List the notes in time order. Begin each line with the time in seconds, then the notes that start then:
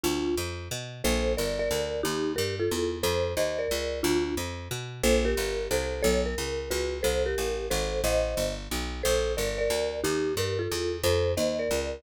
0.04 D2 D4 F4
0.37 F2
0.71 B2
1.04 A#1 A4 C5
1.37 G1 A#4 D5
1.59 A#4 D5
1.71 D2
2.03 D#2 D#4 G4
2.36 G2 G4 A#4
2.60 F4 A4
2.71 E2
3.03 F2 A4 C5
3.37 D#2 C5 D#5
3.59 A#4 D5
3.71 C#2
4.03 D2 D4 F4
4.37 F2
4.71 B2
5.03 A#1 A4 C5
5.25 G4 A#4
5.37 G1
5.71 C2 A4 C5
6.03 B1 A4 C#5
6.26 A#4
6.38 C#2
6.71 C#2 F#4 B4
7.03 C2 A4 C5
7.26 G4 A#4
7.38 A1
7.70 G#1 A4 C5
8.04 A1 C5 D#5
8.37 G1
8.71 B1
9.03 A#1 A4 C5
9.37 G1 A#4 D5
9.58 A#4 D5
9.70 D2
10.04 D#2 D#4 G4
10.37 G2 G4 A#4
10.59 F4 A4
10.72 E2
11.04 F2 A4 C5
11.37 D#2 C5 D#5
11.59 A#4 D5
11.71 C#2